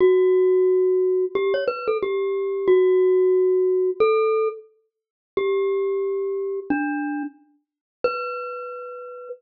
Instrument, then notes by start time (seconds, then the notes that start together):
glockenspiel
0.00 F#4
1.35 G4
1.54 C#5
1.68 B4
1.88 A4
2.03 G4
2.68 F#4
4.00 A4
5.37 G4
6.70 D4
8.04 B4